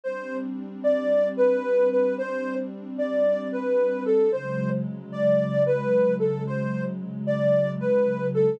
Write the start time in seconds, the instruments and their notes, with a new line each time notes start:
0.04 pad 2 (warm) G3 C4 D4, ocarina C5
0.84 ocarina D5
1.37 ocarina B4
1.91 ocarina B4
2.18 ocarina C5
2.98 ocarina D5
3.52 ocarina B4
4.05 ocarina A4
4.32 pad 2 (warm) C#3 F#3 G#3, ocarina C5
5.12 ocarina D5
5.66 ocarina B4
6.19 ocarina A4
6.47 ocarina C5
7.27 ocarina D5
7.80 ocarina B4
8.34 ocarina A4